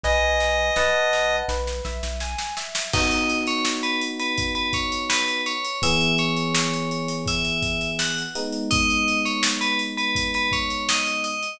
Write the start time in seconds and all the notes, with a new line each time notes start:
0.03 B1 B4 D#5 G#5, kick, snare
0.40 snare
0.76 B1 B4 D#5 F#5 A5, snare
1.13 snare
1.48 B1 B4, snare
1.67 snare
1.85 B1 E5, snare
2.03 B1, snare
2.20 G#5, snare
2.38 snare
2.57 E5, snare
2.75 snare
2.93 B3 D#4 F#4 D#5, kick, crash
3.11 closed hi-hat
3.29 closed hi-hat
3.47 C#5, closed hi-hat
3.65 snare
3.83 B4, closed hi-hat
4.01 closed hi-hat
4.19 B4, closed hi-hat
4.38 kick, closed hi-hat
4.55 B4, closed hi-hat
4.73 C#5, kick, closed hi-hat
4.92 closed hi-hat
5.09 B4, snare
5.28 closed hi-hat
5.46 C#5, closed hi-hat
5.64 closed hi-hat
5.82 E3 B3 G#4 E5, kick, closed hi-hat
6.01 closed hi-hat
6.18 C#5, closed hi-hat
6.36 closed hi-hat
6.55 snare
6.73 closed hi-hat
6.91 closed hi-hat
7.08 closed hi-hat
7.26 E5, kick, closed hi-hat
7.45 closed hi-hat
7.62 kick, closed hi-hat
7.81 closed hi-hat
7.99 F#5, snare
8.18 closed hi-hat
8.35 G#3 B3 D#4, closed hi-hat
8.52 closed hi-hat
8.71 D#5, kick, closed hi-hat
8.90 closed hi-hat
9.08 closed hi-hat
9.25 C#5, closed hi-hat
9.43 snare
9.61 B4, closed hi-hat
9.79 closed hi-hat
9.97 B4, closed hi-hat
10.15 kick, closed hi-hat
10.34 B4, closed hi-hat
10.52 C#5, kick, closed hi-hat
10.70 closed hi-hat
10.89 D#5, snare
11.06 closed hi-hat
11.24 D#5, closed hi-hat
11.43 closed hi-hat